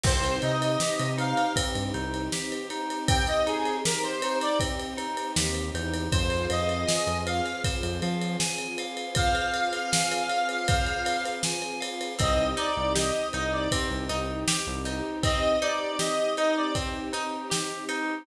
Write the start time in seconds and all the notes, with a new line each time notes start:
0.03 C2 C4 D#4 G4 C5, kick, crash
0.24 ride
0.42 C3 D#4 D#5, ride
0.62 ride
0.80 G4, snare
0.99 C3, ride
1.18 D#4 F5, ride
1.37 ride
1.56 C4, kick, ride
1.75 G2, ride
1.94 C2 D#4, ride
2.14 ride
2.32 G4, snare
2.52 ride
2.70 D#4, ride
2.90 ride
3.08 C4 G5, kick, ride
3.27 D#5, ride
3.46 D#4 G#4, ride
3.65 ride
3.84 G4 A#4, snare
4.03 C5, ride
4.22 D#4, ride
4.41 D5, ride
4.60 C4, kick, ride
4.79 ride
4.97 D#4, ride
5.17 ride
5.36 D#2 G4, snare
5.55 ride
5.74 E2 D#4, ride
5.94 ride
6.12 F2 C4 F4 G#4 C5, kick, ride
6.30 ride
6.50 F2 D#5 F5, ride
6.69 ride
6.88 G#5, snare
7.07 F2, ride
7.26 F5, ride
7.46 ride
7.64 C5, kick, ride
7.83 F2, ride
8.02 F3 F5, ride
8.22 ride
8.40 G#5, snare
8.58 ride
8.78 F5, ride
8.97 ride
9.15 C5 F5, kick, ride
9.35 ride
9.53 F5, ride
9.73 ride
9.92 G#5, snare
10.12 ride
10.29 F5, ride
10.49 ride
10.68 C5, kick, ride
10.86 ride
11.05 F5, ride
11.25 ride
11.43 G#5, snare
11.62 ride
11.80 F5, ride
12.01 ride
12.19 C2 C4 D#4 G4 D#5, kick, ride
12.57 D#4 D5, ride
12.77 C2
12.95 G4 D#5, snare
13.33 C2 D#4 D#5, ride
13.53 D5
13.72 C4, kick, ride
13.91 C2
14.09 C2 D#4, ride
14.48 G4, snare
14.67 C2
14.85 D#4, ride
15.23 C4 D#5, kick, ride
15.62 D#4 D5, ride
15.99 G4 D#5, snare
16.37 D#4 D#5, ride
16.56 D5
16.75 C4, kick, ride
17.13 D#4, ride
17.50 G4, snare
17.89 D#4, ride